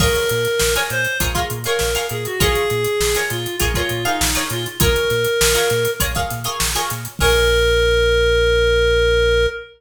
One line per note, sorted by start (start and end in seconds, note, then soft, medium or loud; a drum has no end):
0.00 0.17 A#1 medium
0.00 0.48 F4 loud
0.00 0.48 G#4 loud
0.00 0.74 A#4 medium
0.00 0.48 A#4 loud
0.00 0.48 C#5 loud
0.00 kick loud
0.00 crash loud
0.15 closed hi-hat medium
0.29 0.48 A#2 medium
0.29 closed hi-hat medium
0.45 closed hi-hat medium
0.59 0.78 A#1 medium
0.59 snare loud
0.75 1.11 F4 medium
0.75 1.11 G#4 medium
0.75 1.11 A#4 medium
0.75 1.11 C#5 medium
0.75 closed hi-hat medium
0.90 1.07 A#2 medium
0.90 1.18 C5 medium
0.90 closed hi-hat medium
1.04 closed hi-hat medium
1.20 1.37 A#1 medium
1.20 1.32 F4 loud
1.20 1.32 G#4 loud
1.20 1.32 A#4 loud
1.20 1.32 C#5 loud
1.20 kick loud
1.20 closed hi-hat loud
1.35 1.59 F4 medium
1.35 1.59 G#4 medium
1.35 1.59 A#4 loud
1.35 1.59 C#5 medium
1.35 kick loud
1.35 closed hi-hat medium
1.50 1.67 A#2 medium
1.50 closed hi-hat medium
1.64 1.90 F4 medium
1.64 1.90 G#4 loud
1.64 2.06 A#4 medium
1.64 1.90 A#4 medium
1.64 1.90 C#5 medium
1.64 closed hi-hat medium
1.79 1.97 A#1 medium
1.79 snare loud
1.95 2.31 F4 medium
1.95 2.31 G#4 medium
1.95 2.31 A#4 medium
1.95 2.31 C#5 medium
1.95 closed hi-hat medium
2.09 2.27 A#2 medium
2.09 2.24 G#4 medium
2.09 closed hi-hat medium
2.25 2.40 F#4 medium
2.25 closed hi-hat medium
2.40 2.57 A#1 medium
2.40 2.88 F4 loud
2.40 3.17 G#4 medium
2.40 2.88 G#4 loud
2.40 2.88 A#4 loud
2.40 2.88 C#5 loud
2.40 kick loud
2.40 closed hi-hat loud
2.55 closed hi-hat medium
2.70 2.87 A#2 medium
2.70 closed hi-hat medium
2.84 closed hi-hat medium
3.00 3.17 A#1 medium
3.00 snare loud
3.15 3.51 F4 medium
3.15 3.51 G#4 medium
3.15 3.51 A#4 medium
3.15 3.51 C#5 medium
3.15 snare soft
3.15 closed hi-hat medium
3.30 3.47 A#2 medium
3.30 3.56 F4 medium
3.30 closed hi-hat medium
3.46 closed hi-hat medium
3.60 3.78 A#1 medium
3.60 3.72 F4 loud
3.60 3.72 G#4 loud
3.60 3.72 A#4 loud
3.60 3.72 C#5 loud
3.60 kick medium
3.60 closed hi-hat loud
3.74 3.99 F4 loud
3.74 4.04 F4 medium
3.74 3.99 G#4 medium
3.74 3.99 A#4 medium
3.74 3.99 C#5 loud
3.74 kick loud
3.74 closed hi-hat medium
3.89 4.07 A#2 medium
3.89 closed hi-hat medium
4.05 4.44 D#4 medium
4.05 4.29 F4 loud
4.05 4.29 G#4 medium
4.05 4.29 A#4 medium
4.05 4.29 C#5 medium
4.05 closed hi-hat medium
4.21 4.37 A#1 medium
4.21 snare loud
4.35 4.71 F4 medium
4.35 4.71 G#4 medium
4.35 4.71 A#4 medium
4.35 4.71 C#5 medium
4.35 closed hi-hat medium
4.50 4.67 A#2 medium
4.50 4.65 F4 medium
4.50 closed hi-hat medium
4.66 closed hi-hat medium
4.80 4.97 A#1 medium
4.80 5.28 F4 loud
4.80 5.28 G#4 loud
4.80 5.91 A#4 medium
4.80 5.28 A#4 loud
4.80 5.28 C#5 loud
4.80 kick loud
4.80 closed hi-hat loud
4.96 closed hi-hat medium
5.10 5.27 A#2 medium
5.10 snare medium
5.10 closed hi-hat medium
5.25 closed hi-hat medium
5.41 5.58 A#1 medium
5.41 snare loud
5.55 5.91 F4 medium
5.55 5.91 G#4 loud
5.55 5.91 A#4 medium
5.55 5.91 C#5 medium
5.55 closed hi-hat medium
5.70 5.88 A#2 medium
5.70 snare soft
5.70 closed hi-hat medium
5.85 closed hi-hat medium
6.00 6.17 A#1 medium
6.00 6.12 F4 loud
6.00 6.12 G#4 loud
6.00 6.12 A#4 loud
6.00 6.12 C#5 loud
6.00 kick loud
6.00 closed hi-hat loud
6.15 6.40 F4 medium
6.15 6.40 G#4 medium
6.15 6.40 A#4 loud
6.15 6.40 C#5 medium
6.15 kick loud
6.15 closed hi-hat medium
6.30 6.48 A#2 medium
6.30 snare soft
6.30 closed hi-hat medium
6.44 6.69 F4 medium
6.44 6.69 G#4 medium
6.44 6.69 A#4 medium
6.44 6.69 C#5 loud
6.44 closed hi-hat medium
6.60 6.77 A#1 medium
6.60 snare loud
6.75 7.11 F4 medium
6.75 7.11 G#4 medium
6.75 7.11 A#4 loud
6.75 7.11 C#5 medium
6.75 closed hi-hat medium
6.90 7.08 A#2 medium
6.90 closed hi-hat loud
7.05 closed hi-hat medium
7.19 9.47 A#1 loud
7.19 9.47 F4 loud
7.19 9.47 G#4 loud
7.19 9.46 A#4 loud
7.19 9.47 A#4 loud
7.19 9.47 C#5 loud
7.19 kick loud
7.19 crash loud